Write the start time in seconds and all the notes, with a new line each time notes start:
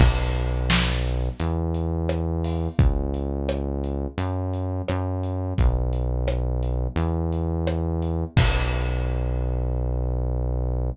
0.00 B1, kick, crash
0.35 closed hi-hat
0.70 snare
1.05 closed hi-hat
1.40 E2, closed hi-hat
1.74 closed hi-hat
2.09 cross-stick
2.44 open hi-hat
2.79 C#2, kick, closed hi-hat
3.14 closed hi-hat
3.49 cross-stick
3.84 closed hi-hat
4.18 F#2, closed hi-hat
4.53 closed hi-hat
4.88 F#2, cross-stick
5.23 closed hi-hat
5.58 B1, kick, closed hi-hat
5.93 closed hi-hat
6.28 cross-stick
6.63 closed hi-hat
6.96 E2, closed hi-hat
7.33 closed hi-hat
7.67 cross-stick
8.02 closed hi-hat
8.36 B1, kick, crash